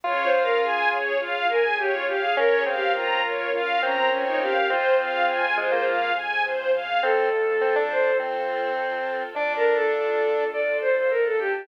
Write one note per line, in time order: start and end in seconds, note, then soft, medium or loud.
0.04 1.12 C#2 medium
0.04 2.34 C#4 medium
0.04 2.34 F4 medium
0.04 0.98 F4 medium
0.04 0.24 F4 medium
0.04 2.34 G#4 medium
0.04 0.30 C#5 loud
0.24 0.43 C5 medium
0.33 0.59 F5 medium
0.43 0.61 A#4 medium
0.62 1.12 G#4 medium
0.62 0.89 G#5 medium
0.91 1.18 C#5 medium
1.20 2.28 C#2 medium
1.20 1.44 F4 medium
1.20 1.46 F5 medium
1.49 1.63 A#4 medium
1.49 1.76 G#5 medium
1.64 1.78 G#4 medium
1.78 1.92 G4 medium
1.78 2.05 C#5 medium
1.94 2.08 F4 medium
2.07 2.21 G4 medium
2.07 2.34 F5 medium
2.22 2.36 G#4 medium
2.37 3.46 A#1 medium
2.37 2.64 C#4 medium
2.37 4.67 C#4 medium
2.37 4.67 F4 medium
2.37 4.67 A#4 medium
2.37 2.56 A#4 medium
2.37 2.63 C#5 loud
2.56 2.75 G#4 medium
2.66 3.21 C4 medium
2.66 2.92 F5 medium
2.75 2.93 G4 medium
2.95 3.51 F4 medium
2.95 3.21 A#5 medium
3.24 3.50 C#5 medium
3.53 4.60 A#1 medium
3.53 3.78 F4 medium
3.53 3.80 F5 medium
3.82 4.58 C4 medium
3.82 3.96 C#4 medium
3.82 4.09 A#5 medium
3.97 4.10 C4 medium
4.10 4.24 C#4 medium
4.10 4.38 C#5 medium
4.27 4.41 D#4 medium
4.41 4.54 G4 medium
4.41 4.67 F5 medium
4.55 4.69 G4 medium
4.70 5.78 F2 medium
4.70 7.00 C4 medium
4.70 5.46 C4 medium
4.70 7.00 F4 medium
4.70 6.08 F4 medium
4.70 7.00 G#4 medium
4.70 4.96 C5 loud
4.99 5.25 F5 medium
5.28 5.55 G#5 medium
5.57 5.71 G#3 medium
5.57 5.84 C5 medium
5.72 6.11 A#3 medium
5.86 6.42 F2 medium
5.86 6.12 F5 medium
6.16 6.42 G#5 medium
6.43 6.70 G2 medium
6.43 6.71 C5 medium
6.73 6.99 F#2 medium
6.73 7.00 F5 medium
7.03 9.17 F2 medium
7.03 7.29 C4 medium
7.03 9.34 C4 medium
7.03 9.34 F4 medium
7.03 7.83 A4 medium
7.03 9.34 A4 medium
7.61 7.75 C4 medium
7.76 8.12 D4 medium
7.91 8.17 C5 medium
8.19 9.23 C4 medium
9.34 11.49 D2 medium
9.34 10.44 D4 medium
9.34 11.67 D4 medium
9.34 11.67 F4 medium
9.34 11.67 A4 medium
9.34 9.53 D5 medium
9.56 9.74 A#4 medium
9.74 9.92 A4 medium
9.93 10.47 A4 medium
10.53 10.77 D5 medium
10.81 10.95 C5 medium
10.97 11.11 C5 medium
11.10 11.24 A#4 medium
11.25 11.39 A4 medium
11.39 11.53 G4 medium
11.53 11.67 G4 medium